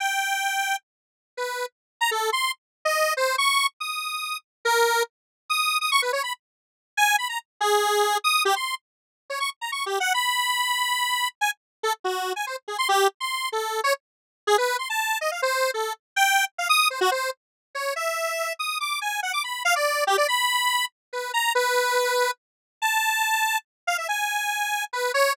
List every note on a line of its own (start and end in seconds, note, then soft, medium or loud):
0.00 0.76 G5 medium
1.37 1.66 B4 medium
2.01 2.10 A#5 medium
2.11 2.30 A4 medium
2.32 2.51 C6 medium
2.85 3.14 D#5 medium
3.17 3.36 C5 medium
3.38 3.67 C#6 loud
3.80 4.37 D#6 medium
4.65 5.03 A#4 loud
5.50 5.78 D#6 medium
5.81 5.90 D#6 medium
5.92 6.01 C#6 loud
6.02 6.12 B4 medium
6.13 6.22 C#5 medium
6.23 6.33 B5 medium
6.97 7.16 G#5 loud
7.18 7.28 B5 medium
7.29 7.39 A#5 medium
7.61 8.18 G#4 loud
8.24 8.43 D#6 loud
8.45 8.55 G4 loud
8.56 8.75 C6 medium
9.30 9.39 C#5 medium
9.40 9.50 C#6 medium
9.61 9.71 A#5 soft
9.72 9.85 C#6 medium
9.86 9.99 G4 medium
10.00 10.13 F#5 medium
10.14 11.28 B5 medium
11.41 11.51 G#5 medium
11.83 11.93 A4 medium
12.04 12.33 F#4 medium
12.36 12.45 G#5 medium
12.47 12.56 C5 medium
12.68 12.77 G#4 medium
12.78 12.88 C6 medium
12.89 13.08 G4 loud
13.20 13.49 C6 medium
13.52 13.81 A4 medium
13.84 13.93 C#5 loud
14.47 14.57 G#4 loud
14.58 14.77 B4 medium
14.79 14.88 C6 medium
14.90 15.18 A5 medium
15.21 15.30 D#5 medium
15.32 15.41 F5 medium
15.42 15.71 C5 medium
15.74 15.93 A4 medium
16.16 16.45 G5 loud
16.58 16.68 F5 medium
16.69 16.88 D#6 loud
16.90 17.00 C5 medium
17.01 17.10 F#4 loud
17.11 17.30 C5 medium
17.75 17.94 C#5 medium
17.96 18.53 E5 medium
18.59 18.78 D#6 medium
18.80 18.99 D6 medium
19.01 19.20 G#5 medium
19.23 19.32 F#5 medium
19.33 19.43 D6 medium
19.44 19.63 B5 soft
19.65 19.74 F5 loud
19.76 20.04 D5 medium
20.07 20.16 G4 loud
20.18 20.27 D5 loud
20.28 20.85 B5 medium
21.13 21.32 B4 medium
21.34 21.53 A#5 medium
21.55 22.31 B4 medium
22.82 23.58 A5 medium
23.87 23.97 F5 medium
23.98 24.07 E5 medium
24.08 24.84 G#5 medium
24.93 25.12 B4 medium
25.14 25.33 C#5 loud